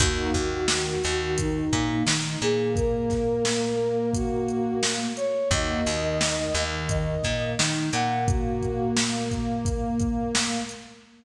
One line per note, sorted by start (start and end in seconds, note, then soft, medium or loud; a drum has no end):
0.00 0.30 D#2 loud
0.00 0.31 A#3 loud
0.00 0.31 D#4 loud
0.00 0.31 F#4 loud
0.00 1.35 F#4 medium
0.00 kick loud
0.00 closed hi-hat loud
0.33 0.95 D#2 loud
0.33 0.94 D#3 medium
0.33 kick medium
0.33 closed hi-hat medium
0.68 snare loud
1.04 1.65 D#2 medium
1.04 1.65 D#3 medium
1.04 closed hi-hat medium
1.37 2.03 D#4 medium
1.37 kick medium
1.37 closed hi-hat loud
1.73 2.03 A#2 loud
1.73 2.03 A#3 medium
1.73 kick medium
1.73 closed hi-hat medium
2.06 2.37 D#3 loud
2.06 2.38 D#4 loud
2.06 snare loud
2.41 5.08 A#2 loud
2.41 5.07 A#3 medium
2.41 2.71 G#4 medium
2.41 closed hi-hat medium
2.76 4.09 A#4 medium
2.76 kick loud
2.76 closed hi-hat medium
3.10 kick medium
3.10 snare soft
3.10 closed hi-hat medium
3.45 snare loud
4.14 4.78 F#4 medium
4.14 kick medium
4.14 closed hi-hat loud
4.48 closed hi-hat medium
4.83 snare loud
5.17 5.48 C#5 medium
5.17 closed hi-hat medium
5.50 5.81 D#2 loud
5.50 5.82 A#3 medium
5.50 5.82 D#4 medium
5.50 5.82 F#4 loud
5.50 6.64 D#5 medium
5.50 kick medium
5.50 closed hi-hat loud
5.86 6.47 D#2 loud
5.86 6.46 D#3 medium
5.86 closed hi-hat medium
6.21 snare loud
6.54 7.15 D#2 loud
6.54 7.16 D#3 medium
6.54 closed hi-hat medium
6.89 7.49 D#5 medium
6.89 kick medium
6.89 closed hi-hat medium
7.23 7.55 A#2 medium
7.23 7.54 A#3 medium
7.23 kick medium
7.23 snare soft
7.23 closed hi-hat medium
7.59 7.90 D#3 loud
7.59 7.90 D#4 medium
7.59 snare loud
7.93 10.59 A#2 loud
7.93 10.60 A#3 medium
7.93 8.25 F#5 medium
7.93 closed hi-hat medium
8.28 8.91 F#4 medium
8.28 kick loud
8.28 closed hi-hat loud
8.62 kick medium
8.62 closed hi-hat medium
8.97 snare loud
9.31 kick medium
9.31 closed hi-hat medium
9.65 kick medium
9.65 closed hi-hat medium
10.00 kick medium
10.00 closed hi-hat medium
10.35 snare loud
10.69 closed hi-hat medium